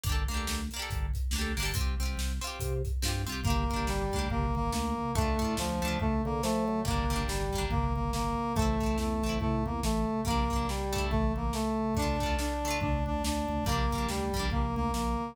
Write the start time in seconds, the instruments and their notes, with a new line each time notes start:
0.03 drawbar organ G1, orchestral harp A#3 D4, kick, closed hi-hat
0.09 orchestral harp G4 A4
0.28 drawbar organ D2, orchestral harp A#3 D4, snare, closed hi-hat
0.34 orchestral harp G4 A4
0.47 drawbar organ D2, snare
0.71 orchestral harp A#3, closed hi-hat
0.76 orchestral harp D4 G4
0.82 orchestral harp A4
0.90 drawbar organ G1, kick, closed hi-hat
1.14 kick, closed hi-hat
1.31 drawbar organ D2, orchestral harp A#3, snare
1.36 orchestral harp D4 G4
1.41 orchestral harp A4
1.57 drawbar organ G1, orchestral harp A#3 D4, open hi-hat
1.63 orchestral harp G4 A4
1.74 drawbar organ C2, orchestral harp C4, kick, closed hi-hat
1.78 orchestral harp F4 G4
2.00 drawbar organ C2, orchestral harp C4 F4, snare, closed hi-hat
2.05 orchestral harp G4
2.17 drawbar organ C2, snare
2.41 orchestral harp C4 F4, closed hi-hat
2.47 orchestral harp G4
2.59 drawbar organ C3, kick, closed hi-hat
2.85 kick, closed hi-hat
3.02 drawbar organ G2, orchestral harp C4 F4, snare
3.08 orchestral harp G4
3.27 drawbar organ C2, orchestral harp C4 F4, closed hi-hat
3.32 orchestral harp G4
3.44 drawbar organ G1, orchestral harp A#3 D4, brass section A#3, kick, floor tom
3.50 orchestral harp G4
3.69 drawbar organ G1, orchestral harp A#3, kick, floor tom
3.73 orchestral harp D4 G4
3.87 drawbar organ G1, brass section G3, snare
4.12 drawbar organ D2, orchestral harp A#3 D4, kick, floor tom
4.19 orchestral harp G4
4.30 drawbar organ G1, brass section A#3, kick, floor tom
4.55 drawbar organ G1, brass section A#3, floor tom
4.72 drawbar organ D2, brass section A#3, snare
4.98 floor tom
5.15 drawbar organ D2, orchestral harp A3 D4, brass section A3, kick, floor tom
5.21 orchestral harp F4
5.39 drawbar organ A2, orchestral harp A3 D4, kick, floor tom
5.45 orchestral harp F4
5.57 drawbar organ D2, brass section F3, snare
5.82 drawbar organ D2, orchestral harp A3 D4, floor tom
5.88 orchestral harp F4
6.00 drawbar organ D2, brass section A3, kick, floor tom
6.24 drawbar organ D3, brass section A#3, floor tom
6.43 drawbar organ F3, brass section A3, snare
6.68 drawbar organ F#3, floor tom
6.85 drawbar organ G1, orchestral harp G3 A#3, brass section A#3, kick, floor tom
6.91 orchestral harp D4
7.09 drawbar organ G1, orchestral harp G3, floor tom
7.13 orchestral harp A#3 D4
7.28 drawbar organ G1, brass section G3, snare
7.52 drawbar organ G1, orchestral harp G3 A#3, kick, floor tom
7.58 orchestral harp D4
7.70 drawbar organ G1, brass section A#3, kick, floor tom
7.95 drawbar organ G1, brass section A#3, floor tom
8.13 drawbar organ G1, brass section A#3, snare
8.38 floor tom
8.56 drawbar organ A1, brass section A3, orchestral harp A3 C4, kick, floor tom
8.62 orchestral harp E4
8.80 drawbar organ A1, orchestral harp A3 C4, kick, floor tom
8.86 orchestral harp E4
8.98 drawbar organ E2, brass section A3, snare
9.22 drawbar organ A1, orchestral harp A3 C4, floor tom
9.29 orchestral harp E4
9.40 drawbar organ A2, brass section A3, kick, floor tom
9.64 drawbar organ E2, brass section A#3, floor tom
9.83 drawbar organ A1, brass section A3, snare
10.08 floor tom
10.25 drawbar organ A#1, orchestral harp G3 A#3, brass section A#3, kick, floor tom
10.30 orchestral harp D4
10.50 drawbar organ A#1, orchestral harp G3 A#3, kick, floor tom
10.56 orchestral harp D4
10.68 brass section G3, snare
10.93 orchestral harp A3 D4, kick, floor tom
10.98 orchestral harp E4
11.11 drawbar organ A1, brass section A3, kick, floor tom
11.36 drawbar organ A1, brass section A#3, floor tom
11.53 brass section A3, snare
11.79 floor tom
11.95 drawbar organ D2, orchestral harp A3, brass section D4, kick, floor tom
11.99 orchestral harp D4 F4
12.20 drawbar organ D2, orchestral harp A3 D4, kick, floor tom
12.26 orchestral harp F4
12.39 brass section D4, snare
12.63 orchestral harp A3, floor tom
12.68 orchestral harp D4 F4
12.80 drawbar organ D2, brass section D4, kick, floor tom
13.05 drawbar organ D2, brass section D4, floor tom
13.24 drawbar organ D2, brass section D4, snare
13.48 drawbar organ D2, floor tom
13.65 drawbar organ A#1, orchestral harp G3, brass section A#3, kick, floor tom
13.69 orchestral harp A#3 D4
13.91 drawbar organ A#1, orchestral harp G3, kick, floor tom
13.95 orchestral harp A#3 D4
14.09 drawbar organ D2, brass section G3, snare
14.33 drawbar organ A#1, orchestral harp G3 A#3, kick, floor tom
14.39 orchestral harp D4
14.50 drawbar organ A#1, brass section A#3, kick, floor tom
14.76 drawbar organ D2, brass section A#3, floor tom
14.94 drawbar organ A#1, brass section A#3, snare
15.19 floor tom